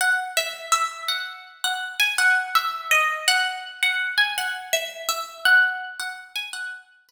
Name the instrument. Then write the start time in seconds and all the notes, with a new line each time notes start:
acoustic guitar (steel)
0.01 F#5
0.37 E5
0.72 E5
1.08 F#5
1.64 F#5
2.00 G#5
2.18 F#5
2.55 E5
2.91 D#5
3.28 F#5
3.83 F#5
4.18 G#5
4.38 F#5
4.73 E5
5.09 E5
5.45 F#5
6.00 F#5
6.36 G#5
6.53 F#5
7.09 B4